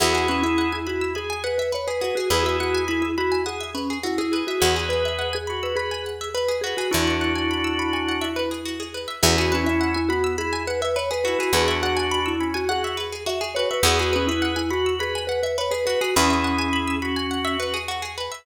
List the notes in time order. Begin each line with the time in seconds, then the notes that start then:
0.00 E2 E4 F#4 G#4
0.13 F#4 G#4
0.28 C#4 B4
0.43 E4 E5
0.58 F#5
0.72 E4 G#5
0.87 E4 F#4 B5
1.01 E6
1.15 G#4 B5
1.30 G#5
1.44 B4 F#5
1.58 B4 E5
1.72 B4 C#5
1.87 G#4 B4
2.01 F#4 G#4 B4
2.15 F#4 G#4
2.30 E2 E4 G#4 B4
2.43 F#4 E5
2.60 F#4 F#5
2.75 G#5
2.88 E4 B5
3.02 E4 E6
3.17 E4 F#4 B5
3.32 G#5
3.46 G#4 F#5
3.61 E5
3.75 C#4 B4
3.90 G#4
4.03 E4 F#4
4.18 E4 G#4
4.32 G#4 B4
4.47 F#4 E5
4.60 E2 F#4 G#4 B4
4.76 G#4
4.89 B4
5.05 E5
5.19 F#5
5.33 G#4 G#5
5.47 F#4 B5
5.63 B4 E6
5.76 G#4 B4 B5
5.91 G#5
6.06 F#5
6.21 E5
6.34 B4
6.48 G#4
6.61 F#4 G#4 B4
6.77 F#4 G#4
6.91 E2 D4 E4 F#4 B4
7.07 E5
7.21 F#5
7.35 G#5
7.51 B5
7.64 E6
7.79 B5
7.93 G#5
8.09 F#5
8.21 E5
8.36 B4
8.51 G#4
8.66 F#4
8.80 G#4
8.94 B4
9.08 E5
9.23 E2 C#4 E4 F#4 G#4
9.38 F#4 G#4
9.52 C#4 B4
9.64 E4 E5
9.81 F#5
9.94 E4 G#5
10.09 B3 F#4 B5
10.24 E6
10.38 E4 G#4 B5
10.53 G#5
10.67 B4 F#5
10.81 B4 E5
10.96 B4 C#5
11.11 G#4 B4
11.24 E4 F#4 B4
11.39 F#4 G#4
11.53 E2 D4 F#4 G#4 B4
11.68 E5
11.82 F#4 F#5
11.97 G#5
12.11 B5
12.26 E4 E6
12.40 C#4 B5
12.54 F#4 G#5
12.69 F#4 G#4 F#5
12.84 E5
12.97 B4
13.12 G#4
13.26 F#4 E5
13.41 G#4
13.55 F#4 B4 C#5
13.71 B4 E5
13.83 E2 F#4 G#4 B4
13.99 F#4 G#4
14.13 C#4 B4
14.27 E4 E5
14.42 F#5
14.56 E4 G#5
14.71 F#4 B5
14.86 E6
14.99 G#4 B4 B5
15.15 G#5
15.27 B4 F#5
15.43 B4 E5
15.58 B4 C#5
15.71 G#4 B4
15.86 F#4 B4
16.01 F#4 G#4
16.16 E2 C#4 E4 G#4 B4
16.30 E5
16.44 F#5
16.59 G#5
16.73 B5
16.88 E6
17.02 F#4 B5
17.16 G#5
17.31 F#5
17.45 E5
17.60 B4
17.74 G#4
17.88 F#4
18.02 G#4
18.18 B4
18.32 E5